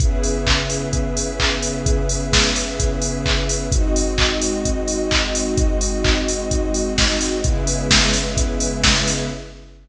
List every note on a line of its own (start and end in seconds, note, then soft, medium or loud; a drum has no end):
0.00 3.68 C#3 medium
0.00 3.68 B3 medium
0.00 3.69 C#4 medium
0.00 3.68 E4 medium
0.00 3.68 G#4 medium
0.00 3.69 G#4 medium
0.00 3.69 B4 medium
0.00 3.69 E5 medium
0.00 kick loud
0.00 closed hi-hat medium
0.23 open hi-hat medium
0.47 kick medium
0.47 clap loud
0.70 open hi-hat medium
0.93 kick medium
0.93 closed hi-hat loud
1.17 open hi-hat medium
1.40 kick medium
1.40 clap loud
1.62 open hi-hat medium
1.86 kick loud
1.86 closed hi-hat loud
2.09 open hi-hat medium
2.33 kick medium
2.33 snare loud
2.56 open hi-hat medium
2.80 kick loud
2.80 closed hi-hat loud
3.02 open hi-hat medium
3.26 kick medium
3.26 clap loud
3.49 open hi-hat medium
3.72 7.41 G#3 medium
3.72 7.41 C4 medium
3.72 7.41 D#4 medium
3.72 7.41 F#4 medium
3.72 7.41 D#5 medium
3.72 kick loud
3.72 closed hi-hat loud
3.96 open hi-hat medium
4.18 kick medium
4.18 clap loud
4.41 open hi-hat medium
4.65 kick medium
4.65 closed hi-hat loud
4.88 open hi-hat medium
5.11 kick medium
5.11 clap loud
5.35 open hi-hat medium
5.57 kick loud
5.57 closed hi-hat loud
5.81 open hi-hat medium
6.04 kick loud
6.04 clap loud
6.28 open hi-hat medium
6.51 kick medium
6.51 closed hi-hat loud
6.74 open hi-hat medium
6.98 kick medium
6.98 snare loud
7.21 open hi-hat medium
7.44 9.29 C#3 medium
7.44 9.29 G#3 medium
7.44 9.29 B3 medium
7.44 9.29 C#4 medium
7.44 9.29 E4 medium
7.44 9.29 G#4 medium
7.44 9.29 B4 medium
7.44 9.29 E5 medium
7.44 kick loud
7.44 closed hi-hat loud
7.67 open hi-hat medium
7.90 kick medium
7.90 snare loud
8.13 open hi-hat medium
8.37 kick loud
8.37 closed hi-hat loud
8.60 open hi-hat medium
8.84 kick medium
8.84 snare loud
9.07 open hi-hat medium